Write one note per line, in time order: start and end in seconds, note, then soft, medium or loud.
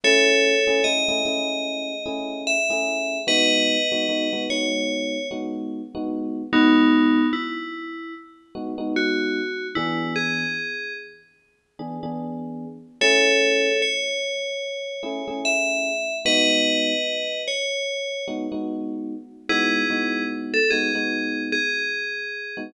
0.04 0.54 A3 loud
0.04 0.54 C#4 loud
0.04 0.54 E4 loud
0.04 0.54 G#4 medium
0.04 0.84 A4 medium
0.04 0.84 C#5 medium
0.67 0.81 A3 medium
0.67 0.81 C#4 medium
0.67 0.81 E4 medium
0.67 0.81 G#4 medium
0.84 1.03 A3 medium
0.84 1.03 C#4 medium
0.84 1.03 E4 medium
0.84 1.03 G#4 medium
0.84 2.42 D#5 medium
1.08 1.22 A3 loud
1.08 1.22 C#4 medium
1.08 1.22 E4 medium
1.08 1.22 G#4 medium
1.25 1.93 A3 medium
1.25 1.93 C#4 medium
1.25 1.93 E4 loud
1.25 1.93 G#4 medium
2.06 2.56 A3 medium
2.06 2.56 C#4 medium
2.06 2.56 E4 medium
2.06 2.56 G#4 medium
2.47 3.18 E5 medium
2.70 3.17 A3 medium
2.70 3.17 C#4 medium
2.70 3.17 E4 medium
2.70 3.17 G#4 medium
3.27 3.77 G#3 loud
3.27 3.77 B3 loud
3.27 3.77 D#4 medium
3.27 3.77 F#4 loud
3.27 4.43 B4 medium
3.27 4.43 D#5 medium
3.92 4.06 G#3 medium
3.92 4.06 B3 medium
3.92 4.06 D#4 medium
3.92 4.06 F#4 medium
4.09 4.28 G#3 medium
4.09 4.28 B3 medium
4.09 4.28 D#4 medium
4.09 4.28 F#4 medium
4.33 4.46 G#3 medium
4.33 4.46 B3 medium
4.33 4.46 D#4 medium
4.33 4.46 F#4 medium
4.50 5.17 G#3 medium
4.50 5.17 B3 medium
4.50 5.17 D#4 medium
4.50 5.17 F#4 medium
4.50 5.28 C#5 medium
5.31 5.81 G#3 medium
5.31 5.81 B3 medium
5.31 5.81 D#4 medium
5.31 5.81 F#4 medium
5.95 6.42 G#3 medium
5.95 6.42 B3 loud
5.95 6.42 D#4 medium
5.95 6.42 F#4 loud
6.53 7.20 G#3 loud
6.53 7.27 B3 medium
6.53 7.20 B3 loud
6.53 7.27 D#4 medium
6.53 7.20 D#4 loud
6.53 7.20 F#4 loud
7.33 8.14 E4 medium
8.55 8.74 G#3 medium
8.55 8.74 B3 medium
8.55 8.74 D#4 medium
8.55 8.74 F#4 loud
8.78 9.40 G#3 loud
8.78 9.40 B3 medium
8.78 9.40 D#4 loud
8.78 9.40 F#4 medium
8.96 9.67 F#4 medium
9.75 10.44 E3 loud
9.75 10.44 B3 loud
9.75 10.44 D4 medium
9.75 10.14 E4 medium
9.75 10.44 G#4 loud
10.16 10.93 G#4 medium
11.79 11.98 E3 medium
11.79 11.98 B3 medium
11.79 11.98 D4 medium
11.79 11.98 G#4 medium
12.03 12.65 E3 medium
12.03 12.65 B3 medium
12.03 12.65 D4 loud
12.03 12.65 G#4 medium
13.01 13.69 A3 loud
13.01 13.69 C#4 loud
13.01 13.69 E4 loud
13.01 13.69 G#4 loud
13.01 13.81 A4 medium
13.01 13.81 C#5 medium
13.82 15.40 C#5 medium
15.03 15.22 A3 medium
15.03 15.22 C#4 medium
15.03 15.22 E4 loud
15.03 15.22 G#4 medium
15.28 15.90 A3 medium
15.28 15.90 C#4 medium
15.28 15.90 E4 medium
15.28 15.90 G#4 medium
15.45 16.16 E5 medium
16.25 16.93 G#3 medium
16.25 16.93 B3 loud
16.25 16.93 D#4 loud
16.25 16.93 F#4 loud
16.25 17.41 B4 medium
16.25 17.41 D#5 medium
17.48 18.25 C#5 medium
18.28 18.46 G#3 medium
18.28 18.46 B3 medium
18.28 18.46 D#4 medium
18.28 18.46 F#4 medium
18.52 19.14 G#3 medium
18.52 19.14 B3 medium
18.52 19.14 D#4 medium
18.52 19.14 F#4 medium
19.49 19.83 G#3 loud
19.49 19.83 B3 loud
19.49 19.83 D#4 loud
19.49 20.24 E4 medium
19.49 19.83 F#4 loud
19.49 20.24 G#4 medium
19.90 20.57 G#3 medium
19.90 20.57 B3 medium
19.90 20.57 D#4 medium
19.90 20.57 F#4 medium
20.54 20.70 A4 medium
20.70 20.91 G#3 medium
20.70 20.91 B3 medium
20.70 20.91 D#4 medium
20.70 20.91 F#4 medium
20.70 21.43 G#4 medium
20.95 21.57 G#3 medium
20.95 21.57 B3 medium
20.95 21.57 D#4 medium
20.95 21.57 F#4 medium
21.52 22.59 G#4 medium
22.57 22.71 G#3 medium
22.57 22.71 B3 medium
22.57 22.71 D#4 medium
22.57 22.71 F#4 medium